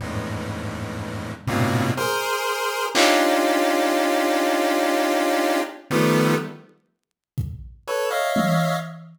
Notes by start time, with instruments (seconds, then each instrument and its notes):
0.00 lead 1 (square) E2 F2 G2 G#2 A2
1.47 lead 1 (square) G2 A2 A#2 B2 C3
1.97 lead 1 (square) G#4 A#4 C5
2.95 lead 1 (square) C#4 D4 D#4 F4 G4, clap
4.43 cowbell
5.91 lead 1 (square) D#3 F3 G3 A3 B3
7.38 kick
7.88 lead 1 (square) A4 B4 C#5
8.10 lead 1 (square) C#5 D#5 E5 F5
8.36 high tom